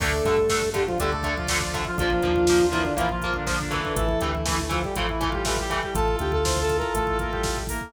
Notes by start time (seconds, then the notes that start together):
0.00 D2 D3 A3 D4 A4 D5, kick, crash
0.11 kick
0.25 G2 D3 A3, kick, closed hi-hat
0.37 kick
0.49 D3 A3, kick, snare
0.62 kick
0.74 D3 G3 A3 G4, kick, closed hi-hat
0.87 F3 F4, kick
0.98 D2 D3 G3 A3 G4 D5, kick, closed hi-hat
1.12 A3 A4, kick
1.23 D3 A3, kick, closed hi-hat
1.37 F3 F4, kick
1.48 D3 F3 A3 F4 D5, kick, snare
1.60 F3 F4 D5, kick
1.73 D3 A3 E5, kick, closed hi-hat
1.85 F3 F4, kick
1.98 A#1 F3 A#3 D4 F4 A#4, kick, closed hi-hat
2.10 kick
2.22 D#2 F3 A#3, kick, closed hi-hat
2.36 kick
2.47 F3 A#3, kick, snare
2.59 kick
2.72 E3 F3 A#3 E4, kick, closed hi-hat
2.85 D3 D4, kick
2.97 A#1 E3 F3 A#3 E4 F4, kick, closed hi-hat
3.09 F3 F4, kick
3.22 F3 A#3, kick, closed hi-hat
3.34 D3 D4, kick
3.47 D3 F3 A#3 D4, kick, snare
3.59 D3 D4, kick
3.71 E3 A3, kick, closed hi-hat
3.84 D3 D4, kick
3.96 A1 E3 E4 A4, kick, closed hi-hat
4.09 kick
4.20 D2 E3 A3 G4, kick, closed hi-hat
4.34 E4, kick
4.46 E3 A3, kick, snare
4.59 kick
4.69 E3 F3 A3 F4, kick, closed hi-hat
4.84 G3 G4, kick
4.95 A1 E3 F3 A3 E4 F4, kick, closed hi-hat
5.09 E3 E4, kick
5.21 E3 A3, kick, closed hi-hat
5.29 G3 F4 G4, kick
5.45 E3 G3 A3 G4, kick, snare
5.56 G3 G4, kick
5.62 G4
5.70 E3 A3, kick, closed hi-hat
5.83 G3 G4, kick
5.95 A1 E4 F4 A4 A5, kick, closed hi-hat
6.08 kick
6.19 D2 G4 G5, kick, closed hi-hat
6.32 A4 A5, kick
6.45 C5 C6, kick, snare
6.57 kick
6.61 A4 A5
6.69 kick, closed hi-hat
6.78 A#4 A#5, kick
6.94 A1 A3 A4, kick, closed hi-hat
7.07 kick
7.19 A#3 A#4, kick, closed hi-hat
7.31 G3 G4, kick
7.43 kick, snare
7.56 kick
7.67 A#3 A#4, kick, open hi-hat
7.81 kick